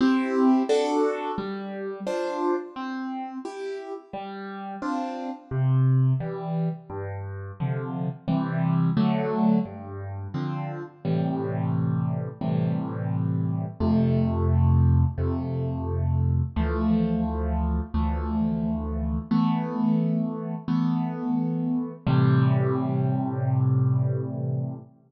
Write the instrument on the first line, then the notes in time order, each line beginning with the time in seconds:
acoustic grand piano
0.01 C4 E4 G4
0.69 D4 F#4 A4
1.38 G3
2.07 D4 F4 C5
2.76 C4
3.45 E4 G4
4.13 G3
4.82 C4 D4 F4
5.51 C3
6.20 E3 G3
6.90 G2
7.60 C3 D3 F3
8.28 C3 E3 G3
8.97 D3 F#3 A3
9.66 G2
10.34 D3 F3 C4
11.05 A2 C3 E3 G3
12.41 A2 C3 E3 G3
13.80 F2 C3 A3
15.18 F2 C3 A3
16.56 D2 E3 F3 A3
17.94 D2 E3 F3 A3
19.31 E3 A3 B3
20.68 E3 A3 B3
22.07 A2 C3 E3 G3